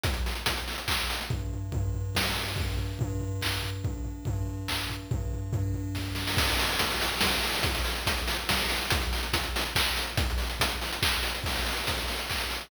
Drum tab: CC |------------|------------|------------|------------|
HH |xxoxxxox-xox|------------|------------|------------|
CP |--------x---|------------|--------x---|--------x---|
SD |------------|--------o---|------------|------------|
FT |------------|o-o-o-o---o-|o-o-o-o---o-|o-o-o-o---o-|
BD |o---o---o---|o---o---o---|o---o---o---|o---o---o---|

CC |------------|x-----------|------------|------------|
HH |------------|-xoxxxox-xoo|xxoxxxox-xox|xxoxxxox-xox|
CP |------------|------------|------------|--------x---|
SD |--------o-oo|--------o---|--------o---|------------|
FT |o-o-o-o-----|------------|------------|------------|
BD |o---o---o---|o---o---o---|o---o---o---|o---o---o---|

CC |------------|x-----------|
HH |xxoxxxox-xox|-xoxxxox-xox|
CP |--------x---|--------x---|
SD |------------|------------|
FT |------------|------------|
BD |o---o---o---|o---o---o---|